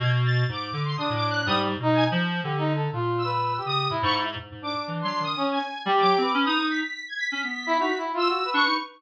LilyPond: <<
  \new Staff \with { instrumentName = "Brass Section" } { \time 3/4 \tempo 4 = 123 r2 d'4 | g8 r16 dis'8 r8. \tuplet 3/2 { g'8 dis'8 a'8 } | \tuplet 3/2 { f'4 b'4 g'4 } e'8. r16 | r8 d'4. cis'8 r8 |
g'8. b'8. r4. | r8. e'16 \tuplet 3/2 { fis'8 e'8 f'8 fis'8 b'8 b'8 } | }
  \new Staff \with { instrumentName = "Lead 1 (square)" } { \time 3/4 gis'''16 r16 a'''8 d'''8. c'''16 \tuplet 3/2 { dis'''8 d'''8 fis'''8 } | dis'''16 r8. gis''16 r4. r16 | r8 e'''4 dis'''8 r16 cis'''16 r8 | r8 d'''8 r16 c'''8 dis'''8 gis''8. |
r16 d'''8. r16 dis'''8 b'''8. gis'''16 b'''16 | b'''4. r16 e'''8. cis'''8 | }
  \new Staff \with { instrumentName = "Clarinet" } { \time 3/4 b,4 gis,8 d8 cis16 a,8. | \tuplet 3/2 { gis,4 b,4 f4 } d4 | ais,4. cis8 a,16 gis,8. | gis,16 gis,8 r16 \tuplet 3/2 { e8 fis8 dis8 } r4 |
\tuplet 3/2 { g8 fis8 c'8 } cis'16 dis'16 dis'8 r4 | cis'16 b8. dis'16 r4 r16 d'16 dis'16 | }
>>